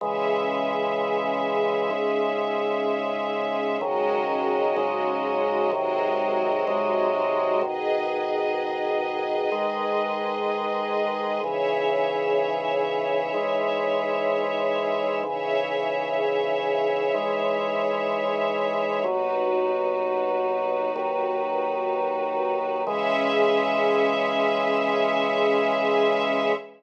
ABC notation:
X:1
M:4/4
L:1/8
Q:1/4=63
K:C#m
V:1 name="Drawbar Organ" clef=bass
[C,E,G,]4 [G,,C,G,]4 | [G,,C,D,F,]2 [G,,C,F,G,]2 [G,,^B,,D,F,]2 [G,,B,,F,G,]2 | [G,,B,,D,]4 [G,,D,G,]4 | [G,,C,E,]4 [G,,E,G,]4 |
[G,,C,E,]4 [G,,E,G,]4 | [D,,B,,F,]4 [D,,D,F,]4 | [C,E,G,]8 |]
V:2 name="String Ensemble 1"
[CGe]8 | [G,CFd]4 [G,^B,Fd]4 | [GBd]8 | [Gce]8 |
[Gce]8 | [DFB]8 | [CGe]8 |]